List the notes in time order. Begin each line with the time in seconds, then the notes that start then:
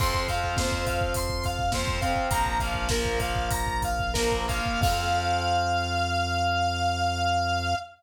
0.00 F2 F3 C4 C6, kick, crash
0.14 kick
0.28 F3 C4 F5, kick, closed hi-hat
0.44 kick
0.56 F3 C4 C5, kick, snare
0.72 kick
0.87 F5, kick, closed hi-hat
1.01 kick
1.14 C6, kick, closed hi-hat
1.29 kick
1.44 F5, kick, closed hi-hat
1.59 kick
1.72 F3 C4 C5, kick, snare
1.87 kick
2.01 F3 C4 F5, kick, closed hi-hat
2.16 kick
2.31 A#1 F3 A#3 A#5, kick, closed hi-hat
2.46 kick
2.59 F3 A#3 F5, kick, closed hi-hat
2.74 kick
2.89 F3 A#3 A#4, kick, snare
3.05 kick
3.20 F5, kick, closed hi-hat
3.35 kick
3.51 A#5, kick, closed hi-hat
3.67 kick
3.82 F5, kick, closed hi-hat
3.99 kick
4.14 F3 A#3 A#4, kick, snare
4.32 kick
4.48 F3 A#3 F5, kick, closed hi-hat
4.66 kick
4.81 F2 F3 F5, kick, crash
4.85 C4